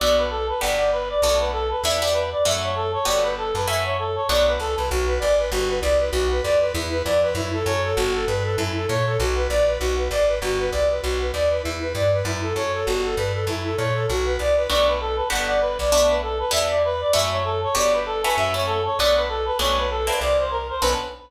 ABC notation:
X:1
M:4/4
L:1/8
Q:"Swing" 1/4=196
K:Bm
V:1 name="Clarinet"
d B A B f d B d | d B A B e d B d | e c A c d B A B | e c A c d B A B |
z8 | z8 | z8 | z8 |
z8 | z8 | z8 | z8 |
d B A B f d B d | d B A B e d B d | e c A c d B A B | e c A c d B A B |
c B A B d =c _B c | B2 z6 |]
V:2 name="Flute"
z8 | z8 | z8 | z8 |
F B d B F B d B | F B d B E B d B | E A c A F A B A | E A c A F B d B |
F B d B F B d B | F B d B E B d B | E A c A F A B A | E A c A F B d B |
z8 | z8 | z8 | z8 |
z8 | z8 |]
V:3 name="Acoustic Guitar (steel)"
[B,DFA]4 [B,DFG]4 | [A,B,DF]4 [B,DEG] [B,DEG]3 | [A,CEF]4 [A,B,FG]4 | [A,CEF]4 [A,B,DF]4 |
z8 | z8 | z8 | z8 |
z8 | z8 | z8 | z8 |
[A,B,DF]4 [B,DFG]4 | [A,B,DF]4 [B,DEG]4 | [A,CEF]4 [A,B,FG]3 [A,CEF]- | [A,CEF] [A,CEF]3 [A,B,DF]4 |
[A,B,CD]3 [_B,=CDE]5 | [B,CDA]2 z6 |]
V:4 name="Electric Bass (finger)" clef=bass
B,,,4 G,,,4 | B,,,4 E,,4 | F,,4 G,,,3 F,,- | F,,4 B,,,2 C,, =C,, |
B,,,2 ^G,,,2 =G,,,2 =C,,2 | B,,,2 =F,,2 E,,2 F,,2 | F,,2 F,,2 G,,,2 G,,2 | F,,2 ^A,,2 B,,,2 ^A,,,2 |
B,,,2 ^G,,,2 =G,,,2 =C,,2 | B,,,2 ^D,,2 E,,2 G,,2 | F,,2 F,,2 G,,,2 G,,2 | F,,2 ^A,,2 B,,,2 =C,,2 |
B,,,4 G,,,3 B,,,- | B,,,4 E,,4 | F,,4 G,,,4 | F,,4 B,,,4 |
B,,,4 =C,,4 | B,,,2 z6 |]